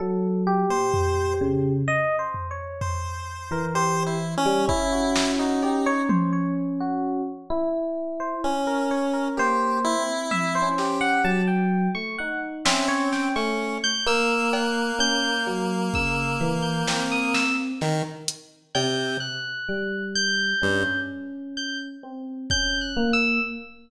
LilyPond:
<<
  \new Staff \with { instrumentName = "Electric Piano 1" } { \time 5/4 \tempo 4 = 64 a'8 g'4. \tuplet 3/2 { dis''8 c''8 cis''8 } r8. ais'16 g'8 r8 | r16 fis'8 fis'16 g'16 cis''16 c''16 cis''16 r16 fis'8 r4 c''16 r16 ais'16 cis''16 ais'16 | c''8. r16 e''16 c''8 fis''16 a''16 g''8 cis'''16 fis''16 r16 e''16 cis''16 g''16 cis'''8 g'''16 | e'''8 fis'''8 g'''8 r8 e'''8 r16 g'''8 dis'''16 e'''16 r4 r16 |
g'''8 fis'''4 g'''4 r8 g'''16 r8. \tuplet 3/2 { g'''8 fis'''8 e'''8 } | }
  \new Staff \with { instrumentName = "Electric Piano 1" } { \time 5/4 fis8. ais,8. cis8 r4. r16 e4 g16 | cis'2. e'4 cis'4 | \tuplet 3/2 { ais4 c'4 cis'4 } fis8. a16 dis'8 cis'8. a8 r16 | ais4 cis'16 r16 fis8 cis8 e8 c'4 r4 |
r4 g4 cis'4. c'8 cis'8 ais8 | }
  \new Staff \with { instrumentName = "Lead 1 (square)" } { \time 5/4 r8. c''8. r4. c''4 \tuplet 3/2 { c''8 e'8 cis'8 } | e'8. dis'8. r2 r8 cis'4 | g'8 e'4 g'8. r4 r16 c'8. cis'8 r16 | ais1 dis16 r8. |
c8 r4. g,16 r2 r8. | }
  \new DrumStaff \with { instrumentName = "Drums" } \drummode { \time 5/4 r4 tomfh4 r8 tomfh8 tomfh4 r4 | bd8 sn8 cb8 tommh8 r4 r4 r4 | r4 tommh8 sn8 r4 r8 sn8 sn4 | r8 cb8 r8 cb8 bd4 sn8 sn8 sn8 hh8 |
cb4 r4 r4 r4 bd4 | }
>>